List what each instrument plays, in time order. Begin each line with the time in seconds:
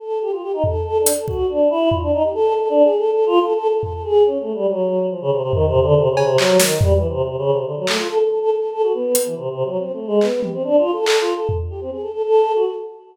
0.00 choir aahs A4
0.21 choir aahs G4
0.32 choir aahs F4
0.42 choir aahs G4
0.53 choir aahs D#4
0.64 choir aahs A4, floor tom
0.85 choir aahs A4
0.99 choir aahs D4
1.06 closed hi-hat
1.13 choir aahs A4
1.28 choir aahs F#4, kick
1.49 choir aahs D4
1.70 choir aahs E4
1.91 choir aahs F4, floor tom
2.02 choir aahs D4
2.13 choir aahs D#4
2.23 choir aahs G4
2.34 choir aahs A4
2.55 choir aahs A4
2.69 choir aahs D4
2.83 choir aahs G#4
2.98 choir aahs A4
3.12 choir aahs A4
3.26 choir aahs F4
3.41 choir aahs A4
3.55 choir aahs A4
3.69 choir aahs A4
3.83 choir aahs A4, floor tom
3.93 choir aahs A4
4.04 choir aahs G#4
4.26 choir aahs C#4
4.40 choir aahs A3
4.54 choir aahs G3
4.68 choir aahs F#3
5.11 choir aahs F3
5.21 choir aahs C#3
5.32 choir aahs C3
5.43 choir aahs C3
5.53 choir aahs D#3, floor tom
5.67 choir aahs C3
5.74 floor tom
5.81 choir aahs D3
5.96 choir aahs C3
6.10 choir aahs C#3
6.17 cowbell
6.24 choir aahs C3
6.38 choir aahs F#3, clap
6.59 choir aahs D#3, snare
6.81 choir aahs G3, floor tom
6.95 choir aahs E3
7.09 choir aahs C3
7.23 choir aahs C3
7.38 choir aahs C#3
7.52 choir aahs C3
7.66 choir aahs D3
7.77 choir aahs F#3
7.87 choir aahs A3, clap
7.98 choir aahs F4
8.09 choir aahs A4
8.19 choir aahs A4
8.30 choir aahs A4
8.40 choir aahs A4
8.51 choir aahs A4
8.72 choir aahs A4
8.83 choir aahs F#4
8.94 choir aahs B3
9.15 closed hi-hat
9.25 choir aahs E3
9.36 choir aahs C3
9.51 choir aahs C3
9.65 choir aahs F#3
9.79 choir aahs C4
9.93 choir aahs A3
10.07 choir aahs G#3
10.21 choir aahs B3, clap
10.43 choir aahs G4, high tom
10.53 choir aahs C4
10.64 choir aahs D4
10.78 choir aahs F4
10.92 choir aahs A4
11.06 choir aahs A4, clap
11.20 choir aahs F4
11.35 choir aahs A4
11.49 floor tom
11.70 choir aahs G4
11.81 choir aahs C4
11.91 choir aahs G#4
12.02 choir aahs A4
12.13 choir aahs A4
12.23 choir aahs A4
12.55 choir aahs F#4
12.66 choir aahs A4